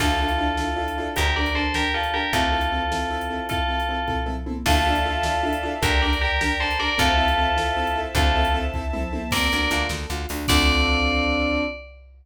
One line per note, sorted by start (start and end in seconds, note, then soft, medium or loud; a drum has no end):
0.00 1.08 D2 medium
0.00 0.07 D4 medium
0.00 1.15 D4 medium
0.00 0.07 E4 medium
0.00 1.15 E4 medium
0.00 0.07 F4 medium
0.00 1.15 F4 medium
0.00 1.09 F4 medium
0.00 0.07 A4 medium
0.00 1.15 A4 medium
0.00 1.09 A4 medium
0.00 kick medium
0.00 crash medium
0.20 0.28 D4 medium
0.20 0.28 E4 medium
0.20 0.28 F4 medium
0.20 0.28 A4 medium
0.28 closed hi-hat medium
0.38 0.46 D4 medium
0.38 0.46 E4 medium
0.38 0.46 F4 medium
0.38 0.46 A4 medium
0.57 0.66 D4 medium
0.57 0.66 E4 medium
0.57 0.66 F4 medium
0.57 0.66 A4 medium
0.57 snare medium
0.76 0.84 D4 medium
0.76 0.84 E4 medium
0.76 0.84 F4 medium
0.76 0.84 A4 medium
0.88 closed hi-hat medium
0.98 1.06 D4 medium
0.98 1.06 E4 medium
0.98 1.06 F4 medium
0.98 1.06 A4 medium
1.16 2.25 D2 medium
1.16 1.24 D4 medium
1.16 2.32 D4 medium
1.16 1.24 G4 medium
1.16 1.33 G4 medium
1.16 2.32 G4 medium
1.16 1.24 A#4 medium
1.16 1.33 A#4 medium
1.16 2.32 A#4 medium
1.16 kick medium
1.16 closed hi-hat loud
1.36 1.44 D4 medium
1.36 1.44 G4 medium
1.36 1.55 A#4 medium
1.36 1.44 A#4 medium
1.36 1.55 D5 medium
1.46 closed hi-hat medium
1.55 1.62 D4 medium
1.55 1.62 G4 medium
1.55 1.73 A4 medium
1.55 1.62 A#4 medium
1.55 1.73 C5 medium
1.74 1.83 D4 medium
1.74 1.91 G4 medium
1.74 1.83 G4 medium
1.74 1.91 A#4 medium
1.74 1.83 A#4 medium
1.74 snare loud
1.94 2.02 D4 medium
1.94 2.13 F4 soft
1.94 2.02 G4 medium
1.94 2.13 A4 medium
1.94 2.02 A#4 medium
2.03 closed hi-hat medium
2.14 2.21 D4 medium
2.14 2.21 G4 medium
2.14 2.32 G4 medium
2.14 2.21 A#4 medium
2.14 2.32 A#4 medium
2.33 3.40 D2 medium
2.33 2.41 C4 medium
2.33 3.48 C4 medium
2.33 2.41 E4 medium
2.33 3.48 E4 medium
2.33 3.45 F4 medium
2.33 2.41 A4 medium
2.33 3.45 A4 medium
2.33 3.48 A4 medium
2.33 kick medium
2.33 closed hi-hat medium
2.52 2.60 C4 medium
2.52 2.60 E4 medium
2.52 2.60 A4 medium
2.61 closed hi-hat medium
2.72 2.79 C4 medium
2.72 2.79 E4 medium
2.72 2.79 A4 medium
2.91 2.99 C4 medium
2.91 2.99 E4 medium
2.91 2.99 A4 medium
2.91 snare medium
3.11 3.18 C4 medium
3.11 3.18 E4 medium
3.11 3.18 A4 medium
3.21 closed hi-hat medium
3.30 3.38 C4 medium
3.30 3.38 E4 medium
3.30 3.38 A4 medium
3.49 3.57 C4 medium
3.49 3.57 E4 medium
3.49 4.20 F4 medium
3.49 3.57 A4 medium
3.49 4.20 A4 medium
3.49 kick medium
3.49 closed hi-hat medium
3.68 3.76 C4 medium
3.68 3.76 E4 medium
3.68 3.76 A4 medium
3.80 closed hi-hat medium
3.89 3.97 C4 medium
3.89 3.97 E4 medium
3.89 3.97 A4 medium
4.07 4.15 C4 medium
4.07 4.15 E4 medium
4.07 4.15 A4 medium
4.07 kick medium
4.07 floor tom medium
4.26 4.34 C4 medium
4.26 4.34 E4 medium
4.26 4.34 A4 medium
4.26 mid tom medium
4.46 4.54 C4 medium
4.46 4.54 E4 medium
4.46 4.54 A4 medium
4.46 high tom medium
4.66 5.73 D2 medium
4.66 4.74 D4 loud
4.66 4.74 E4 medium
4.66 4.74 F4 medium
4.66 5.67 F4 medium
4.66 4.74 A4 medium
4.66 5.67 A4 medium
4.66 5.82 D5 medium
4.66 5.82 E5 medium
4.66 5.82 F5 medium
4.66 5.82 A5 medium
4.66 kick medium
4.66 crash loud
4.86 4.94 D4 medium
4.86 4.94 E4 medium
4.86 4.94 F4 medium
4.86 4.94 A4 medium
4.95 closed hi-hat medium
5.06 5.13 D4 medium
5.06 5.13 E4 medium
5.06 5.13 F4 medium
5.06 5.13 A4 medium
5.23 5.32 D4 medium
5.23 5.32 E4 medium
5.23 5.32 F4 medium
5.23 5.32 A4 medium
5.23 snare loud
5.43 5.51 D4 medium
5.43 5.51 E4 medium
5.43 5.51 F4 medium
5.43 5.51 A4 medium
5.53 closed hi-hat medium
5.63 5.71 D4 medium
5.63 5.71 E4 medium
5.63 5.71 F4 medium
5.63 5.71 A4 medium
5.82 6.90 D2 medium
5.82 5.90 D4 medium
5.82 5.90 G4 medium
5.82 6.01 G4 medium
5.82 5.90 A#4 medium
5.82 6.01 A#4 medium
5.82 6.98 D5 medium
5.82 6.98 G5 medium
5.82 6.98 A#5 medium
5.82 kick loud
5.82 closed hi-hat medium
6.02 6.10 D4 medium
6.02 6.10 G4 medium
6.02 6.18 A#4 medium
6.02 6.10 A#4 medium
6.02 6.18 D5 medium
6.13 closed hi-hat medium
6.21 6.28 D4 medium
6.21 6.28 G4 medium
6.21 6.38 G4 medium
6.21 6.28 A#4 medium
6.21 6.38 A#4 medium
6.41 6.49 D4 medium
6.41 6.57 G4 medium
6.41 6.49 G4 medium
6.41 6.57 A#4 medium
6.41 6.49 A#4 medium
6.41 snare loud
6.60 6.68 D4 medium
6.60 6.68 G4 medium
6.60 6.77 A4 medium
6.60 6.68 A#4 medium
6.60 6.77 C5 medium
6.70 closed hi-hat medium
6.79 6.87 D4 medium
6.79 6.87 G4 medium
6.79 6.87 A#4 medium
6.79 6.97 A#4 medium
6.79 6.97 D5 medium
6.98 8.06 D2 medium
6.98 7.06 C4 loud
6.98 7.06 E4 medium
6.98 7.97 F4 medium
6.98 7.06 A4 medium
6.98 7.97 A4 medium
6.98 8.14 C5 medium
6.98 8.14 E5 medium
6.98 8.14 A5 medium
6.98 kick medium
6.98 closed hi-hat medium
7.18 7.25 C4 medium
7.18 7.25 E4 medium
7.18 7.25 A4 medium
7.28 closed hi-hat medium
7.38 7.45 C4 medium
7.38 7.45 E4 medium
7.38 7.45 A4 medium
7.57 7.64 C4 medium
7.57 7.64 E4 medium
7.57 7.64 A4 medium
7.57 snare medium
7.77 7.84 C4 medium
7.77 7.84 E4 medium
7.77 7.84 A4 medium
7.87 closed hi-hat medium
7.96 8.03 C4 medium
7.96 8.03 E4 medium
7.96 8.03 A4 medium
8.15 9.22 D2 medium
8.15 8.24 C4 loud
8.15 8.24 E4 medium
8.15 8.54 F4 medium
8.15 8.54 A4 medium
8.15 8.24 A4 medium
8.15 9.31 C5 medium
8.15 9.31 E5 medium
8.15 9.31 A5 medium
8.15 kick loud
8.15 closed hi-hat medium
8.35 8.43 C4 medium
8.35 8.43 E4 medium
8.35 8.43 A4 medium
8.45 closed hi-hat medium
8.54 8.62 C4 medium
8.54 8.62 E4 medium
8.54 8.62 A4 medium
8.74 8.82 C4 medium
8.74 8.82 E4 medium
8.74 8.82 A4 medium
8.74 kick medium
8.93 9.01 C4 medium
8.93 9.01 E4 medium
8.93 9.01 A4 medium
8.93 mid tom medium
9.12 9.20 C4 medium
9.12 9.20 E4 medium
9.12 9.20 A4 medium
9.12 high tom loud
9.31 9.48 D2 medium
9.31 9.50 C4 medium
9.31 9.81 A#4 medium
9.31 9.81 D5 medium
9.31 kick medium
9.31 crash loud
9.51 9.69 D2 medium
9.51 9.69 D4 medium
9.51 closed hi-hat medium
9.71 9.87 D2 medium
9.71 9.88 F4 medium
9.71 closed hi-hat medium
9.89 10.06 D2 medium
9.89 10.07 A4 medium
9.89 snare medium
10.10 10.26 D2 medium
10.10 10.27 F4 medium
10.10 closed hi-hat medium
10.29 10.46 D2 medium
10.29 10.48 D4 medium
10.29 open hi-hat medium
10.48 11.62 D2 loud
10.48 11.62 C4 medium
10.48 11.62 D4 loud
10.48 11.62 F4 medium
10.48 11.62 A4 loud
10.48 11.61 D5 loud
10.48 kick loud
10.48 crash loud